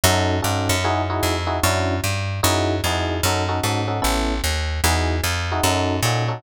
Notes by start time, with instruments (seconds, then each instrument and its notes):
0.04 electric bass (finger) F#2, electric piano 1 C#4 D#4 F#4 A4
0.42 electric bass (finger) G2, electric piano 1 C#4 D#4 F#4 A4
0.69 electric bass (finger) F#2
0.84 electric piano 1 D#4 E4 F#4 G#4
1.10 electric piano 1 D#4 E4 F#4 G#4
1.23 electric bass (finger) F2
1.47 electric piano 1 D#4 E4 F#4 G#4
1.63 electric bass (finger) F#2, electric piano 1 C#4 D4 E4 F#4
2.04 electric bass (finger) G2
2.43 electric bass (finger) F#2, electric piano 1 D#4 E4 F#4 G#4
2.84 electric bass (finger) F2, electric piano 1 D#4 E4 F#4 G#4
3.23 electric bass (finger) F#2, electric piano 1 C#4 D#4 F#4 A4
3.49 electric piano 1 C#4 D#4 F#4 A4
3.64 electric bass (finger) G#2, electric piano 1 C#4 D#4 F#4 A4
3.88 electric piano 1 C#4 D#4 F#4 A4
4.02 electric bass (finger) A1, electric piano 1 B3 C#4 E4 A4
4.44 electric bass (finger) D#2
4.84 electric bass (finger) E2, electric piano 1 D#4 E4 F#4 G#4
5.24 electric bass (finger) F2
5.52 electric piano 1 D#4 E4 F#4 G#4
5.64 electric bass (finger) F#2, electric piano 1 C#4 D#4 F#4 A4
6.03 electric bass (finger) A#2, electric piano 1 C#4 D#4 F#4 A4
6.28 electric piano 1 C#4 D#4 F#4 A4